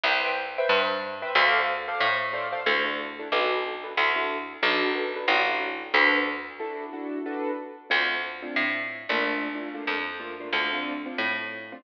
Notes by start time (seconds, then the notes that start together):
0.03 C2 B4 C5 E5 G5
0.58 B4 C5 E5 G5
0.69 G2
1.22 B4 C5 E5 G5
1.35 D2 A4 C5 D5 F5
1.88 A4 C5 D5 F5
2.00 A2
2.33 A4 C5 D5 F5
2.52 A4 C5 D5 F5
2.66 D2 D4 E4 F#4 A4
2.85 D4 E4 F#4 A4
3.19 D4 E4 F#4 A4
3.32 B1 D4 F#4 A4 B4
3.84 D4 F#4 A4 B4
3.97 D2 D4 E4 F#4 A4
4.16 D4 E4 F#4 A4
4.62 B1 D4 F#4 A4 B4
4.95 D4 F#4 A4 B4
5.16 D4 F#4 A4 B4
5.28 A1 D4 E4 F#4 A4
5.48 D4 E4 F#4 A4
5.94 D2 D4 F#4 A4 B4
6.60 D4 E4 F#4 A4
6.93 D4 E4 F#4 A4
7.26 D4 F#4 A4 B4
7.90 D2 A3 C4 D4 F4
8.42 A3 C4 D4 F4
8.56 A2
9.09 A#1 A3 A#3 D4 F4
9.55 A3 A#3 D4 F4
9.74 A3 A#3 D4 F4
9.87 F2
10.20 A3 A#3 D4 F4
10.40 A3 A#3 D4 F4
10.53 D2 A3 C4 D4 F4
10.73 A3 C4 D4 F4
11.06 A3 C4 D4 F4
11.18 A2
11.72 A3 C4 D4 F4